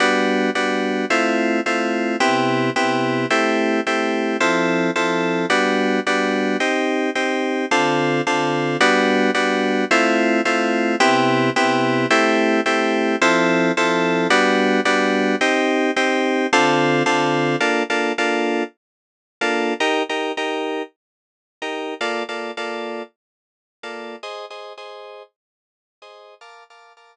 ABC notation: X:1
M:4/4
L:1/16
Q:"Swing 16ths" 1/4=109
K:Gmix
V:1 name="Electric Piano 2"
[G,B,D^F]4 [G,B,DF]4 [A,CE=F]4 [A,CEF]4 | [C,B,EG]4 [C,B,EG]4 [A,CEG]4 [A,CEG]4 | [F,CEA]4 [F,CEA]4 [G,B,D^F]4 [G,B,DF]4 | [C_EG]4 [CEG]4 [D,CFA]4 [D,CFA]4 |
[G,B,D^F]4 [G,B,DF]4 [A,CE=F]4 [A,CEF]4 | [C,B,EG]4 [C,B,EG]4 [A,CEG]4 [A,CEG]4 | [F,CEA]4 [F,CEA]4 [G,B,D^F]4 [G,B,DF]4 | [C_EG]4 [CEG]4 [D,CFA]4 [D,CFA]4 |
[K:Bbmix] [B,DF=A]2 [B,DFA]2 [B,DFA]9 [B,DFA]3 | [EGB]2 [EGB]2 [EGB]9 [EGB]3 | [B,F=Ad]2 [B,FAd]2 [B,FAd]9 [B,FAd]3 | [Ace]2 [Ace]2 [Ace]9 [Ace]3 |
[Bf=ad']2 [Bfad']2 [Bfad']9 z3 |]